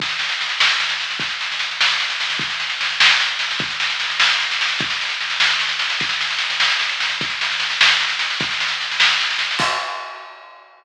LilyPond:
\new DrumStaff \drummode { \time 6/8 \tempo 4. = 100 <bd sn>16 sn16 sn16 sn16 sn16 sn16 sn16 sn16 sn16 sn16 sn16 sn16 | <bd sn>16 sn16 sn16 sn16 sn16 sn16 sn16 sn16 sn16 sn16 sn16 sn16 | <bd sn>16 sn16 sn16 sn16 sn16 sn16 sn16 sn16 sn8 sn16 sn16 | <bd sn>16 sn16 sn16 sn16 sn16 sn16 sn16 sn16 sn16 sn16 sn16 sn16 |
<bd sn>16 sn16 sn16 sn16 sn16 sn16 sn16 sn16 sn16 sn16 sn16 sn16 | <bd sn>16 sn16 sn16 sn16 sn16 sn16 sn16 sn16 sn16 sn16 sn16 sn16 | <bd sn>16 sn16 sn16 sn16 sn16 sn16 sn16 sn16 sn16 sn16 sn16 sn16 | <bd sn>16 sn16 sn16 sn16 sn16 sn16 sn16 sn16 sn16 sn16 sn16 sn16 |
<cymc bd>4. r4. | }